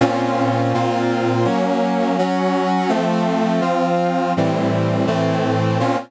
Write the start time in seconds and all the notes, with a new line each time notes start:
0.01 A#2 C4 C#4 F4
0.74 A#2 A#3 C4 F4
1.45 F#3 A#3 C#4
2.18 F#3 C#4 F#4
2.89 F3 A3 C4
3.61 F3 C4 F4
4.37 A2 E3 G3 C4
5.07 A2 E3 A3 C4
5.80 A#2 C4 C#4 F4